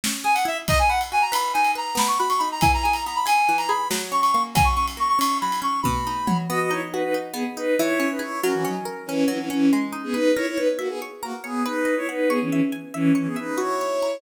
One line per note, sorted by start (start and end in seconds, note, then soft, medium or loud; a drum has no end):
0.04 0.67 C#4 medium
0.04 snare medium
0.24 0.65 G#4 medium
0.24 0.34 G#5 medium
0.34 0.44 F#5 medium
0.34 ride medium
0.45 0.66 E4 medium
0.45 0.57 E5 medium
0.68 1.54 D#4 medium
0.68 0.79 D#5 loud
0.68 kick medium
0.68 ride medium
0.79 0.89 G#5 medium
0.89 1.31 B4 medium
0.89 0.99 F#5 medium
1.01 ride medium
1.12 1.94 F#4 medium
1.12 1.23 G#5 medium
1.22 1.32 A#5 medium
1.32 1.75 B4 medium
1.32 1.53 B5 medium
1.32 ride medium
1.54 1.96 D#4 medium
1.54 1.71 G#5 medium
1.64 ride medium
1.75 1.96 B4 medium
1.75 1.98 A#5 medium
1.95 2.56 B3 medium
1.95 2.08 B5 medium
1.95 snare medium
2.08 2.18 C#6 medium
2.18 2.61 F#4 medium
2.18 2.29 B5 medium
2.29 2.39 C#6 medium
2.29 ride medium
2.38 2.61 D#4 medium
2.38 2.49 B5 medium
2.52 2.62 A#5 medium
2.61 3.48 E3 medium
2.61 2.71 G#5 medium
2.61 kick medium
2.61 ride medium
2.74 2.84 A#5 medium
2.83 3.25 G#4 medium
2.83 2.93 G#5 medium
2.92 3.03 A#5 medium
2.92 ride medium
3.06 3.88 B3 medium
3.06 3.17 A#5 medium
3.16 3.26 B5 medium
3.26 3.68 G#4 medium
3.26 3.57 G#5 medium
3.26 ride medium
3.49 3.89 E3 medium
3.58 3.68 A#5 medium
3.58 ride medium
3.68 3.89 G#4 medium
3.68 3.88 B5 medium
3.90 4.52 F#3 medium
3.90 snare medium
4.12 4.53 C#4 medium
4.12 4.21 C#6 medium
4.21 4.31 C#6 medium
4.21 ride medium
4.32 4.55 A#3 medium
4.32 4.42 C#6 medium
4.55 5.41 F#3 medium
4.55 4.66 G#5 medium
4.55 kick loud
4.55 ride medium
4.65 4.75 C#6 medium
4.75 5.18 C#4 medium
4.75 4.86 C#6 medium
4.88 ride medium
4.97 5.79 A#3 medium
4.97 5.08 C#6 medium
5.09 5.19 C#6 medium
5.19 5.61 C#4 medium
5.19 5.38 C#6 medium
5.19 ride medium
5.41 5.83 F#3 medium
5.41 5.60 B5 medium
5.52 ride medium
5.62 5.82 C#4 medium
5.62 5.80 C#6 medium
5.83 6.46 B2 medium
5.83 6.37 B5 medium
5.83 kick medium
5.83 high tom medium
6.07 6.48 D#4 medium
6.27 6.48 F#3 medium
6.27 mid tom loud
6.49 7.33 B3 medium
6.49 6.59 F#4 medium
6.49 6.59 D#5 loud
6.60 6.70 F#4 medium
6.60 6.70 D#5 medium
6.71 7.14 D#4 medium
6.71 6.81 E4 medium
6.71 6.81 C#5 medium
6.92 7.02 D#4 medium
6.92 7.75 F#4 medium
6.92 7.02 B4 medium
7.03 7.13 D#4 medium
7.03 7.13 B4 medium
7.14 7.56 D#4 medium
7.33 7.43 B3 medium
7.33 7.74 B3 medium
7.33 7.43 G#4 medium
7.57 7.75 D#4 medium
7.57 7.77 D#4 medium
7.57 7.75 B4 medium
7.78 8.41 E3 loud
7.78 8.08 E4 medium
7.78 8.08 C#5 medium
8.00 8.40 C#4 medium
8.10 8.20 D#4 medium
8.10 8.20 B4 medium
8.19 8.40 E4 medium
8.19 8.40 G#4 medium
8.19 8.40 C#5 medium
8.41 9.27 F#3 loud
8.41 8.52 C#4 medium
8.41 8.52 A#4 loud
8.53 8.64 E3 medium
8.53 8.64 C#4 medium
8.64 8.74 F#3 medium
8.64 9.08 C#4 medium
8.64 8.74 D#4 medium
8.85 9.67 A#4 medium
9.06 9.24 E3 medium
9.06 9.24 C#4 medium
9.06 9.49 C#4 medium
9.28 9.38 E3 medium
9.28 9.69 F#3 medium
9.28 9.38 C#4 medium
9.39 9.49 E3 medium
9.39 9.49 C#4 medium
9.50 9.70 E3 medium
9.50 9.70 C#4 medium
9.73 10.34 G#3 medium
9.92 10.33 D#4 medium
10.04 10.14 B3 medium
10.04 10.14 G#4 medium
10.13 10.31 D#4 medium
10.13 10.31 B4 medium
10.13 10.34 B4 medium
10.35 10.46 E4 medium
10.35 11.22 A#4 medium
10.35 10.46 C#5 medium
10.48 10.58 E4 medium
10.48 10.58 C#5 medium
10.57 10.67 D#4 medium
10.57 10.67 B4 medium
10.57 11.01 C#5 medium
10.78 10.88 A#3 medium
10.78 10.88 F#4 medium
10.78 11.60 E5 medium
10.89 10.99 B3 medium
10.89 10.99 G#4 medium
11.02 11.43 C#5 medium
11.22 11.33 A#3 medium
11.22 11.33 F#4 medium
11.22 11.64 A#4 medium
11.44 11.63 B3 medium
11.44 11.63 G#4 medium
11.44 11.64 C#5 medium
11.64 11.95 D#4 medium
11.64 11.95 B4 medium
11.64 12.27 B4 medium
11.85 12.26 D#5 medium
11.97 12.07 E4 medium
11.97 12.07 C#5 loud
12.09 12.29 D#4 medium
12.09 12.29 B4 medium
12.09 12.29 F#5 medium
12.29 12.39 B3 medium
12.29 12.39 G#4 loud
12.29 13.14 C#5 medium
12.41 12.50 E3 medium
12.41 12.50 C#4 medium
12.50 12.60 E3 medium
12.50 12.60 C#4 medium
12.50 12.94 E5 medium
12.72 13.54 G#5 medium
12.94 13.12 E3 medium
12.94 13.12 C#4 medium
12.94 13.36 E5 medium
13.15 13.27 E3 medium
13.15 13.27 C#4 medium
13.15 13.56 C#5 medium
13.26 13.36 B3 medium
13.26 13.36 G#4 medium
13.36 13.59 D#4 medium
13.36 13.59 B4 medium
13.36 13.56 E5 medium
13.58 14.17 E4 medium
13.58 14.19 F#4 medium
13.58 14.17 C#5 medium
13.81 14.21 C#5 medium
14.02 14.21 A#5 medium